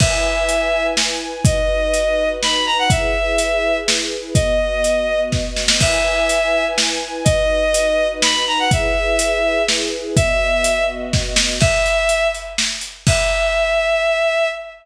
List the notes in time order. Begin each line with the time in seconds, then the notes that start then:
0.00 E4 B4 E5 G#5, kick, crash
0.49 closed hi-hat
0.97 snare
1.45 D#4 F#4 B4 D#5, kick, closed hi-hat
1.94 closed hi-hat
2.43 B5, snare
2.66 A#5
2.79 F#5
2.90 E4 G#4 B4 E5, kick, closed hi-hat
3.38 closed hi-hat
3.88 snare
4.34 B3 F#4 D#5, kick, closed hi-hat
4.84 closed hi-hat
5.32 kick, snare
5.56 snare
5.68 snare
5.80 E4 B4 E5 G#5, kick, crash
6.29 closed hi-hat
6.78 snare
7.24 D#4 F#4 B4 D#5, kick, closed hi-hat
7.74 closed hi-hat
8.22 B5, snare
8.47 A#5
8.59 F#5
8.71 E4 G#4 B4 E5, kick, closed hi-hat
9.19 closed hi-hat
9.68 snare
10.16 B3 F#4 D#5 E5, kick, closed hi-hat
10.64 closed hi-hat
11.13 kick, snare
11.36 snare
11.60 E5, kick, crash
11.86 closed hi-hat
12.09 closed hi-hat
12.34 closed hi-hat
12.58 snare
12.81 closed hi-hat
13.07 E5, kick, crash